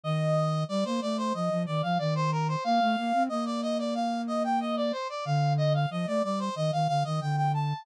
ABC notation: X:1
M:4/4
L:1/16
Q:1/4=92
K:Bb
V:1 name="Brass Section"
e4 d c d c e2 d f d c B c | f4 e d e d f2 e g e d c d | f2 e f e d d c e f f e g g a2 |]
V:2 name="Flute"
E,4 G, B, A,2 F, F, E, F, E,4 | B, A, B, C B,12 | D,4 F, A, G,2 E, E, D, E, D,4 |]